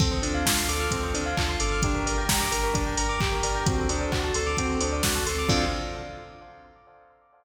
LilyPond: <<
  \new Staff \with { instrumentName = "Lead 2 (sawtooth)" } { \time 4/4 \key d \minor \tempo 4 = 131 c'8 d'8 f'8 a'8 c'8 d'8 f'8 a'8 | d'8 bes'8 g'8 bes'8 d'8 bes'8 g'8 bes'8 | c'8 d'8 fis'8 a'8 c'8 d'8 fis'8 a'8 | <c' d' f' a'>4 r2. | }
  \new Staff \with { instrumentName = "Tubular Bells" } { \time 4/4 \key d \minor a'16 c''16 d''16 f''16 a''16 c'''16 d'''16 f'''16 a'16 c''16 d''16 f''16 a''16 c'''16 d'''16 f'''16 | g'16 bes'16 d''16 g''16 bes''16 d'''16 g'16 bes'16 d''16 g''16 bes''16 d'''16 g'16 bes'16 d''16 g''16 | fis'16 a'16 c''16 d''16 fis''16 a''16 c'''16 d'''16 fis'16 a'16 c''16 d''16 fis''16 a''16 c'''16 d'''16 | <a' c'' d'' f''>4 r2. | }
  \new Staff \with { instrumentName = "Synth Bass 2" } { \clef bass \time 4/4 \key d \minor d,8 d,8 d,8 d,8 d,8 d,8 d,8 g,,8~ | g,,8 g,,8 g,,8 g,,8 g,,8 g,,8 g,,8 g,,8 | d,8 d,8 d,8 d,8 d,8 d,8 d,8 d,8 | d,4 r2. | }
  \new Staff \with { instrumentName = "Pad 2 (warm)" } { \time 4/4 \key d \minor <c' d' f' a'>1 | <d' g' bes'>1 | <c' d' fis' a'>1 | <c' d' f' a'>4 r2. | }
  \new DrumStaff \with { instrumentName = "Drums" } \drummode { \time 4/4 <cymc bd>8 hho8 <bd sn>8 hho8 <hh bd>8 hho8 <hc bd>8 hho8 | <hh bd>8 hho8 <bd sn>8 hho8 <hh bd>8 hho8 <hc bd>8 hho8 | <hh bd>8 hho8 <hc bd>8 hho8 <hh bd>8 hho8 <bd sn>8 hho8 | <cymc bd>4 r4 r4 r4 | }
>>